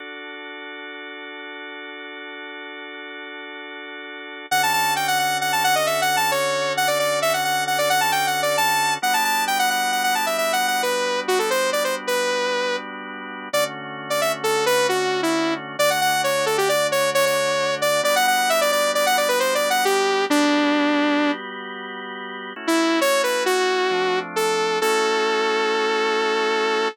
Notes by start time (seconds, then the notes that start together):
0.00 D4 F#4 A4
4.51 D3 C#4 F#4 A4 F#5
4.63 A5
4.73 A5
4.96 G5
5.08 F#5
5.19 F#5
5.41 F#5
5.53 A5
5.64 F#5
5.75 D#5
5.86 E5
6.02 F#5
6.17 A5
6.31 C#5
6.77 F#5
6.88 D5
6.99 D5
7.22 E5
7.34 F#5
7.45 F#5
7.67 F#5
7.78 D5
7.90 F#5
8.01 A5
8.12 G5
8.27 F#5
8.42 D5
8.57 A5
9.02 G3 B3 D4 F#4 F#5
9.14 A5
9.25 A5
9.47 G5
9.59 F#5
9.70 F#5
9.92 F#5
10.04 F#5
10.15 A5
10.26 E5
10.38 E5
10.53 F#5
10.68 F#5
10.83 B4
11.28 F#4
11.39 A4
11.50 C5
11.73 D5
11.84 C5
12.07 B4
13.53 D3 A3 C#4 F#4 D5
14.10 D5
14.21 E5
14.44 A4
14.66 B4
14.89 F#4
15.23 E4
15.79 D3 A3 D4 F#4 D5
15.90 F#5
16.01 F#5
16.24 C#5
16.46 A4
16.58 G4
16.69 D5
16.92 C#5
17.15 C#5
17.26 C#5
17.82 D5
18.03 G3 B3 D4 F#4 D5
18.16 F#5
18.27 F#5
18.50 E5
18.61 D5
18.72 D5
18.95 D5
19.06 F#5
19.17 D5
19.28 B4
19.40 C5
19.55 D5
19.70 F#5
19.85 G4
20.30 G3 B3 D4 F#4 G4
22.56 A3 C#4 E4 F#4
22.67 E4
23.01 C#5
23.23 B4
23.46 F#4
23.91 F3 A3 C4 D4
24.36 A4
24.81 A3 C#4 E4 F#4 A4